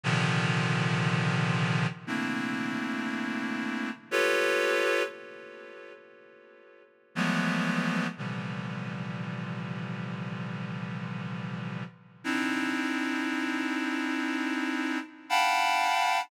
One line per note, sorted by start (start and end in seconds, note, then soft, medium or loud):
0.04 1.87 A#2 loud
0.04 1.87 C3 loud
0.04 1.87 D3 loud
0.04 1.87 D#3 loud
0.04 1.87 F3 loud
2.07 3.90 A3 medium
2.07 3.90 A#3 medium
2.07 3.90 C4 medium
2.07 3.90 D4 medium
2.07 3.90 E4 medium
4.11 5.03 F4 loud
4.11 5.03 G4 loud
4.11 5.03 A4 loud
4.11 5.03 B4 loud
4.11 5.03 C#5 loud
7.15 8.07 E3 medium
7.15 8.07 F3 medium
7.15 8.07 F#3 medium
7.15 8.07 G#3 medium
7.15 8.07 A3 medium
7.15 8.07 B3 medium
8.18 11.84 A#2 medium
8.18 11.84 C3 medium
8.18 11.84 D3 medium
8.18 11.84 E3 medium
8.18 11.84 F3 medium
8.18 11.84 G3 medium
12.24 14.99 C4 medium
12.24 14.99 D4 medium
12.24 14.99 D#4 medium
12.24 14.99 E4 medium
15.29 16.21 F5 loud
15.29 16.21 F#5 loud
15.29 16.21 G5 loud
15.29 16.21 A5 loud
15.29 16.21 B5 loud